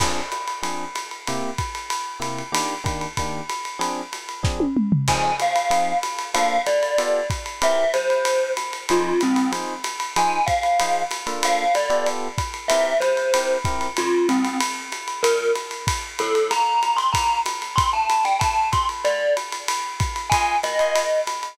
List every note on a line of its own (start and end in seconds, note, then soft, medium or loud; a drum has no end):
0.00 0.21 F3 medium
0.00 0.21 C4 medium
0.00 0.21 D4 medium
0.00 0.21 G#4 medium
0.00 kick medium
0.00 crash loud
0.00 ride loud
0.32 hi-hat pedal loud
0.32 ride medium
0.47 ride medium
0.62 0.85 F3 medium
0.62 0.85 C4 medium
0.62 0.85 D4 medium
0.62 0.85 G#4 medium
0.62 ride loud
0.95 hi-hat pedal medium
0.95 ride loud
1.11 ride medium
1.27 1.50 C3 medium
1.27 1.50 A#3 medium
1.27 1.50 E4 medium
1.27 1.50 G4 medium
1.27 ride loud
1.58 kick medium
1.58 hi-hat pedal medium
1.58 ride medium
1.75 ride medium
1.90 ride loud
2.20 2.42 C3 medium
2.20 2.42 A#3 medium
2.20 2.42 E4 medium
2.20 2.42 G4 medium
2.20 hi-hat pedal medium
2.20 ride medium
2.38 ride medium
2.52 2.74 D#3 medium
2.52 2.74 A#3 medium
2.52 2.74 D4 medium
2.52 2.74 G4 medium
2.52 ride loud
2.84 3.06 D#3 medium
2.84 3.06 A#3 medium
2.84 3.06 D4 medium
2.84 3.06 G4 medium
2.84 kick medium
2.84 hi-hat pedal medium
2.84 ride medium
3.01 ride medium
3.17 3.41 D#3 medium
3.17 3.41 A#3 medium
3.17 3.41 D4 medium
3.17 3.41 G4 medium
3.17 kick medium
3.17 ride loud
3.49 hi-hat pedal medium
3.49 ride medium
3.65 ride medium
3.79 4.01 F3 medium
3.79 4.01 C4 medium
3.79 4.01 D4 medium
3.79 4.01 G#4 medium
3.79 ride loud
4.13 hi-hat pedal medium
4.13 ride medium
4.29 ride medium
4.43 4.65 F3 medium
4.43 4.65 C4 medium
4.43 4.65 D4 medium
4.43 4.65 G#4 medium
4.43 kick medium
4.43 snare medium
4.60 high tom medium
4.77 mid tom medium
4.92 floor tom loud
5.08 5.31 F3 medium
5.08 5.31 C4 medium
5.08 5.31 D#4 medium
5.08 5.31 G#4 medium
5.08 5.36 G#5 medium
5.08 kick medium
5.08 crash loud
5.08 ride loud
5.40 5.98 F5 medium
5.40 hi-hat pedal medium
5.40 ride loud
5.56 ride loud
5.70 5.93 F3 medium
5.70 5.93 C4 medium
5.70 5.93 D#4 medium
5.70 5.93 G#4 medium
5.70 ride loud
6.03 hi-hat pedal medium
6.03 ride loud
6.19 ride medium
6.34 6.57 A#3 medium
6.34 6.57 D4 medium
6.34 6.57 F4 medium
6.34 6.57 A4 medium
6.34 6.62 F5 loud
6.34 ride loud
6.66 7.27 D5 medium
6.66 hi-hat pedal loud
6.66 ride loud
6.83 ride medium
6.98 7.20 B3 medium
6.98 7.20 F4 loud
6.98 7.20 G4 medium
6.98 7.20 A4 medium
6.98 ride loud
7.30 kick medium
7.30 hi-hat pedal medium
7.30 ride medium
7.46 ride medium
7.62 7.84 C4 medium
7.62 7.84 E4 medium
7.62 7.84 G4 medium
7.62 7.84 A#4 medium
7.62 7.93 E5 medium
7.62 ride loud
7.94 8.51 C5 medium
7.94 hi-hat pedal medium
7.94 ride loud
8.10 ride medium
8.25 ride loud
8.57 hi-hat pedal loud
8.57 ride medium
8.73 ride medium
8.89 9.12 F3 medium
8.89 9.12 D#4 loud
8.89 9.20 F4 medium
8.89 9.12 G#4 medium
8.89 9.12 C5 medium
8.89 ride loud
9.21 9.51 C4 medium
9.21 hi-hat pedal medium
9.21 ride loud
9.36 ride loud
9.52 9.74 F3 medium
9.52 9.74 D#4 medium
9.52 9.74 G#4 medium
9.52 9.74 C5 medium
9.52 ride loud
9.84 hi-hat pedal loud
9.84 ride loud
10.00 ride medium
10.16 10.38 F3 medium
10.16 10.38 D#4 medium
10.16 10.38 G#4 medium
10.16 10.38 C5 loud
10.16 10.45 G#5 medium
10.16 ride loud
10.46 11.03 F5 medium
10.46 kick medium
10.46 hi-hat pedal loud
10.46 ride loud
10.63 ride medium
10.79 11.03 F3 medium
10.79 11.03 D#4 medium
10.79 11.03 G#4 medium
10.79 11.03 C5 medium
10.79 ride loud
11.11 hi-hat pedal loud
11.11 ride loud
11.27 11.65 A#3 medium
11.27 11.65 D4 medium
11.27 11.65 F4 medium
11.27 11.65 A4 medium
11.27 ride medium
11.43 11.72 F5 loud
11.43 ride loud
11.74 12.07 D5 medium
11.74 hi-hat pedal medium
11.74 ride loud
11.90 12.28 B3 medium
11.90 12.28 F4 medium
11.90 12.28 G4 medium
11.90 12.28 A4 medium
11.90 ride medium
12.06 ride loud
12.38 kick medium
12.38 hi-hat pedal medium
12.38 ride loud
12.54 ride medium
12.68 12.93 C4 medium
12.68 12.93 E4 loud
12.68 12.93 G4 medium
12.68 12.93 A#4 medium
12.68 12.98 E5 medium
12.68 ride loud
13.00 13.58 C5 medium
13.00 hi-hat pedal loud
13.00 ride medium
13.17 ride medium
13.34 13.57 C4 medium
13.34 13.57 E4 medium
13.34 13.57 G4 medium
13.34 13.57 A#4 medium
13.34 ride loud
13.65 13.87 C4 medium
13.65 13.87 E4 medium
13.65 13.87 G4 medium
13.65 13.87 A#4 medium
13.65 kick medium
13.65 hi-hat pedal loud
13.65 ride loud
13.81 ride medium
13.97 14.27 F4 medium
13.97 ride loud
14.29 14.57 C4 medium
14.29 hi-hat pedal loud
14.29 ride loud
14.45 ride medium
14.60 ride loud
14.92 hi-hat pedal medium
14.92 ride medium
15.08 ride medium
15.23 15.51 A#4 medium
15.23 ride loud
15.55 hi-hat pedal loud
15.55 ride loud
15.71 ride medium
15.87 kick medium
15.87 ride loud
16.19 16.50 A4 medium
16.19 hi-hat pedal medium
16.19 ride loud
16.35 ride medium
16.51 16.96 A#5 medium
16.51 ride loud
16.83 hi-hat pedal medium
16.83 ride medium
16.97 17.10 C6 medium
16.97 ride medium
17.13 17.39 A#5 medium
17.13 kick medium
17.13 ride loud
17.46 hi-hat pedal loud
17.46 ride loud
17.62 ride medium
17.76 17.90 C6 medium
17.76 kick medium
17.76 ride loud
17.93 18.23 A5 medium
18.09 hi-hat pedal medium
18.09 ride loud
18.25 18.38 G5 medium
18.25 ride medium
18.39 18.68 A5 medium
18.39 kick medium
18.39 ride loud
18.72 18.86 C6 medium
18.72 kick medium
18.72 hi-hat pedal loud
18.72 ride loud
18.89 ride medium
19.05 19.34 D5 medium
19.05 ride medium
19.37 hi-hat pedal loud
19.37 ride loud
19.52 ride medium
19.68 ride loud
20.00 kick medium
20.00 hi-hat pedal loud
20.00 ride loud
20.16 ride medium
20.30 20.56 F4 medium
20.30 20.56 D#5 medium
20.30 20.57 G#5 medium
20.30 20.56 G#5 loud
20.30 20.56 C6 medium
20.30 kick medium
20.30 ride loud
20.63 21.20 D#5 medium
20.63 hi-hat pedal medium
20.63 ride loud
20.79 21.03 F4 medium
20.79 21.03 D#5 medium
20.79 21.03 G#5 medium
20.79 21.03 C6 medium
20.79 ride medium
20.96 ride loud
21.27 hi-hat pedal medium
21.27 ride loud
21.43 ride medium